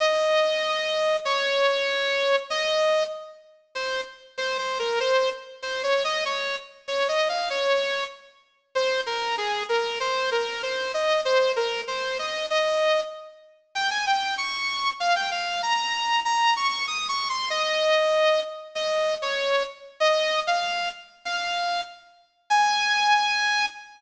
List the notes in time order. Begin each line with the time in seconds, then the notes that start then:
0.00 D#5
1.25 C#5
2.50 D#5
3.75 C5
4.38 C5
4.58 C5
4.79 A#4
5.00 C5
5.62 C5
5.83 C#5
6.04 D#5
6.25 C#5
6.88 C#5
7.08 D#5
7.29 F5
7.50 C#5
8.75 C5
9.06 A#4
9.38 G#4
9.69 A#4
10.00 C5
10.31 A#4
10.63 C5
10.94 D#5
11.25 C5
11.56 A#4
11.87 C5
12.19 D#5
12.50 D#5
13.75 G5
13.90 G#5
14.06 G5
14.38 C#6
15.00 F5
15.15 G5
15.31 F5
15.62 A#5
16.25 A#5
16.56 C#6
16.87 D#6
17.08 C#6
17.29 C6
17.50 D#5
18.75 D#5
19.22 C#5
20.00 D#5
20.47 F5
21.25 F5
22.50 G#5